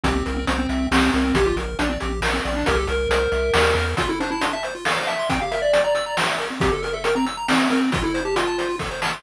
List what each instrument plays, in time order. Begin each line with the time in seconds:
0.03 synth bass 1 C2, lead 1 (square) C4 G4, kick, closed hi-hat
0.16 lead 1 (square) C4
0.26 synth bass 1 C2, lead 1 (square) A#4, closed hi-hat
0.37 lead 1 (square) C4
0.47 synth bass 1 C2, lead 1 (square) C4 C5, closed hi-hat
0.59 lead 1 (square) C4
0.69 synth bass 1 C2, lead 1 (square) E5, closed hi-hat
0.91 synth bass 1 C2, lead 1 (square) C4 G4, snare
1.13 synth bass 1 C2, lead 1 (square) C4 A#4, closed hi-hat
1.25 lead 1 (square) C4
1.34 synth bass 1 A#1, lead 1 (square) G4, kick, closed hi-hat
1.46 lead 1 (square) F4
1.56 synth bass 1 A#1, lead 1 (square) A#4, closed hi-hat
1.79 synth bass 1 A#1, lead 1 (square) D4 D5, closed hi-hat
1.90 lead 1 (square) C4
2.00 synth bass 1 A#1, lead 1 (square) G4, closed hi-hat
2.21 synth bass 1 A#1, lead 1 (square) A#4, snare
2.33 lead 1 (square) C4
2.45 synth bass 1 A#1, lead 1 (square) D5, closed hi-hat
2.56 lead 1 (square) D4
2.66 synth bass 1 C2, lead 1 (square) G4 A#4, kick, closed hi-hat
2.77 lead 1 (square) A4
2.87 synth bass 1 C2, lead 1 (square) A#4, closed hi-hat
3.09 synth bass 1 C2, lead 1 (square) A#4 C5, closed hi-hat
3.32 synth bass 1 C2, lead 1 (square) E5, closed hi-hat
3.54 synth bass 1 D#2, lead 1 (square) G4, snare
3.75 synth bass 1 E2, lead 1 (square) A#4, closed hi-hat
3.97 lead 1 (square) F4, kick, closed hi-hat
4.09 lead 1 (square) E4 A4
4.20 lead 1 (square) D4 C5, closed hi-hat
4.30 lead 1 (square) E4 A5
4.41 lead 1 (square) D4 C6, closed hi-hat
4.53 lead 1 (square) E5 A5
4.63 lead 1 (square) C5, closed hi-hat
4.75 lead 1 (square) F4
4.85 lead 1 (square) A4 F5, snare
4.97 lead 1 (square) C5
5.07 lead 1 (square) E5 A5, closed hi-hat
5.19 lead 1 (square) C6
5.29 lead 1 (square) C4 G5, kick, closed hi-hat
5.41 lead 1 (square) G4 F5
5.51 lead 1 (square) A#4 E5, closed hi-hat
5.62 lead 1 (square) D5 E5
5.73 lead 1 (square) G5, closed hi-hat
5.84 lead 1 (square) D5 A#5
5.95 lead 1 (square) E6, closed hi-hat
6.06 lead 1 (square) A#5
6.17 lead 1 (square) G5, snare
6.28 lead 1 (square) E5
6.39 lead 1 (square) A#4, closed hi-hat
6.50 lead 1 (square) C4
6.60 lead 1 (square) C4 G4, kick, closed hi-hat
6.72 lead 1 (square) G4 A4
6.82 lead 1 (square) A#4, closed hi-hat
6.93 lead 1 (square) A4 E5
7.04 lead 1 (square) A#4 G5, closed hi-hat
7.15 lead 1 (square) C4 A#5
7.26 lead 1 (square) E6, closed hi-hat
7.37 lead 1 (square) A#5
7.48 lead 1 (square) C4 G5, snare
7.60 lead 1 (square) E5
7.70 lead 1 (square) C4 A#4, closed hi-hat
7.81 lead 1 (square) C4
7.92 lead 1 (square) F4, kick, closed hi-hat
8.03 lead 1 (square) E4 A4
8.14 lead 1 (square) C5, closed hi-hat
8.25 lead 1 (square) G4 A5
8.36 lead 1 (square) F4 C6, closed hi-hat
8.47 lead 1 (square) A5
8.58 lead 1 (square) C5, closed hi-hat
8.69 lead 1 (square) F4
8.79 lead 1 (square) A4, kick, snare
8.91 lead 1 (square) C5
9.02 lead 1 (square) A5, snare
9.13 lead 1 (square) C6